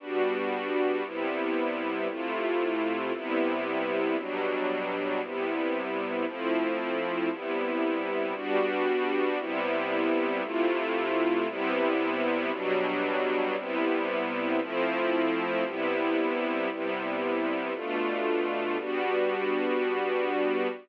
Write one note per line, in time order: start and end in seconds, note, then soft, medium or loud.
0.00 1.03 G3 loud
0.00 1.03 B3 medium
0.00 1.03 D4 medium
0.00 1.03 F#4 medium
1.04 2.08 C3 medium
1.04 2.08 G3 medium
1.04 2.08 B3 medium
1.04 2.08 E4 medium
2.09 3.12 C3 loud
2.09 3.12 A3 medium
2.09 3.12 E4 medium
2.09 3.12 F4 medium
3.13 4.17 C3 loud
3.13 4.17 G3 medium
3.13 4.17 B3 loud
3.13 4.17 E4 loud
4.18 5.21 B2 medium
4.18 5.21 F#3 loud
4.18 5.21 G3 medium
4.18 5.21 D4 medium
5.22 6.25 C3 medium
5.22 6.25 G3 medium
5.22 6.25 B3 medium
5.22 6.25 E4 medium
6.26 7.30 F3 loud
6.26 7.30 A3 medium
6.26 7.30 C4 medium
6.26 7.30 E4 medium
7.31 8.34 C3 medium
7.31 8.34 G3 medium
7.31 8.34 B3 medium
7.31 8.34 E4 loud
8.35 9.38 G3 loud
8.35 9.38 B3 medium
8.35 9.38 D4 loud
8.35 9.38 F#4 loud
9.39 10.42 C3 loud
9.39 10.42 G3 loud
9.39 10.42 B3 loud
9.39 10.42 E4 loud
10.43 11.47 C3 loud
10.43 11.47 A3 loud
10.43 11.47 E4 loud
10.43 11.47 F4 loud
11.48 12.51 C3 loud
11.48 12.51 G3 loud
11.48 12.51 B3 loud
11.48 12.51 E4 loud
12.52 13.56 B2 loud
12.52 13.56 F#3 loud
12.52 13.56 G3 loud
12.52 13.56 D4 loud
13.57 14.60 C3 loud
13.57 14.60 G3 loud
13.57 14.60 B3 loud
13.57 14.60 E4 loud
14.61 15.64 F3 loud
14.61 15.64 A3 medium
14.61 15.64 C4 loud
14.61 15.64 E4 loud
15.65 16.69 C3 loud
15.65 16.69 G3 medium
15.65 16.69 B3 loud
15.65 16.69 E4 loud
16.70 17.73 C3 loud
16.70 17.73 G3 medium
16.70 17.73 B3 medium
16.70 17.73 E4 medium
17.74 18.77 B2 medium
17.74 18.77 A3 loud
17.74 18.77 D4 medium
17.74 18.77 F4 medium
18.78 20.68 G3 loud
18.78 20.68 B3 loud
18.78 20.68 D4 medium
18.78 20.68 F#4 loud